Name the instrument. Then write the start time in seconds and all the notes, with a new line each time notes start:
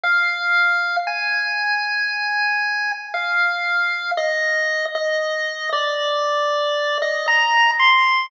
lead 1 (square)
0.03 F5
1.07 G#5
3.14 F5
4.17 D#5
4.95 D#5
5.72 D5
7.02 D#5
7.28 A#5
7.79 C6